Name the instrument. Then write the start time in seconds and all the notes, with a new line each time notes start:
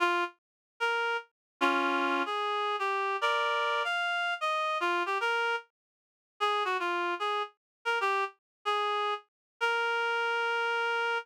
clarinet
0.00 F4
0.80 A#4
1.61 C#4 F4
2.26 G#4
2.79 G4
3.21 A#4 D5
3.84 F5
4.41 D#5
4.80 F4
5.06 G4
5.21 A#4
6.40 G#4
6.65 F#4
6.80 F4
7.20 G#4
7.85 A#4
8.01 G4
8.65 G#4
9.61 A#4